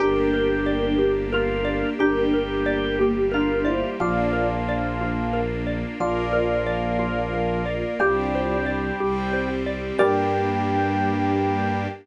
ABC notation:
X:1
M:6/8
L:1/8
Q:3/8=60
K:Gdor
V:1 name="Electric Piano 1"
[DB]6 | [DB]3 [B,G] [DB] [Ec] | [Fd]2 z4 | [Fd]6 |
[Fd]2 z4 | g6 |]
V:2 name="Drawbar Organ"
G4 F2 | G4 F2 | F,5 z | F,6 |
G,5 z | G,6 |]
V:3 name="Xylophone"
G B d G B d | G B d G B d | F B d F B d | F B d F B d |
G c d G c d | [GBd]6 |]
V:4 name="Violin" clef=bass
G,,,6 | G,,,6 | B,,,6 | B,,,6 |
C,,3 C,,3 | G,,6 |]
V:5 name="String Ensemble 1"
[B,DG]6 | [G,B,G]6 | [B,DF]6 | [B,FB]6 |
[CDG]3 [G,CG]3 | [B,DG]6 |]